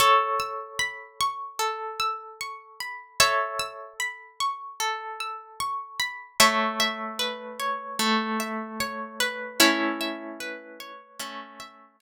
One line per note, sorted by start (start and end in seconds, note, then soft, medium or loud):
0.00 2.83 A4 medium
0.00 1.59 A4 medium
0.00 2.83 C#5 medium
0.40 1.99 E6 medium
0.79 2.80 B5 medium
1.21 2.40 C#6 medium
1.59 3.19 A4 medium
2.00 3.59 E6 medium
2.41 4.40 C#6 medium
2.80 3.99 B5 medium
3.20 4.79 A4 medium
3.20 3.94 C#5 medium
3.20 3.94 E5 medium
3.60 5.20 E6 medium
4.00 5.99 B5 medium
4.40 5.60 C#6 medium
4.80 6.32 A4 medium
5.20 6.34 E6 medium
5.60 6.36 C#6 medium
6.00 6.38 B5 medium
6.40 7.99 A3 medium
6.40 9.46 C#5 medium
6.40 9.46 E5 medium
6.80 8.39 E5 medium
7.19 9.20 B4 medium
7.60 8.80 C#5 medium
7.99 9.59 A3 medium
8.40 10.00 E5 medium
8.80 10.79 C#5 medium
9.20 10.40 B4 medium
9.60 11.19 A3 medium
9.60 10.92 C#4 medium
9.60 10.92 E4 medium
10.01 11.59 E5 medium
10.40 12.01 B4 medium
10.80 12.00 C#5 medium
11.20 12.01 A3 medium
11.20 11.96 C#4 medium
11.60 12.01 E5 medium
12.00 12.01 C#5 medium